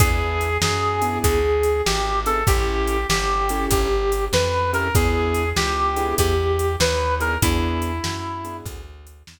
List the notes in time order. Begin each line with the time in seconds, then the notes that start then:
0.00 E2 B3 D4 E4 G#4, kick, closed hi-hat
0.41 closed hi-hat
0.62 F#2 G#4, snare
1.02 B3 D4 E4 G#4, closed hi-hat
1.24 D2 G#4, kick, closed hi-hat
1.63 closed hi-hat
1.86 G#1 G4, snare
2.26 B3 D4 E4 G#4 A4, closed hi-hat
2.47 A1 C#4 E4 G4 A4, kick, closed hi-hat
2.88 closed hi-hat
3.09 G1 G4, snare
3.49 C#4 E4 G4 A4, closed hi-hat
3.71 G1 G4, kick, closed hi-hat
4.12 closed hi-hat
4.33 F2 B4, snare
4.73 C#4 E4 G4 A4 A#4, closed hi-hat
4.95 E2 B3 D4 E4 G#4, kick, closed hi-hat
5.34 closed hi-hat
5.56 C#2 G4, snare
5.96 B3 D4 E4 G#4, closed hi-hat
6.18 E2 G4, kick, closed hi-hat
6.59 closed hi-hat
6.80 D#2 B4, snare
7.20 B3 D4 E4 G#4 A#4, closed hi-hat
7.42 E2 B3 D4 E4 G#4, kick, closed hi-hat
7.82 closed hi-hat
8.04 F#2, snare
8.44 B3 D4 E4 G#4, closed hi-hat
8.65 D2, kick, closed hi-hat
9.07 closed hi-hat
9.27 E2, snare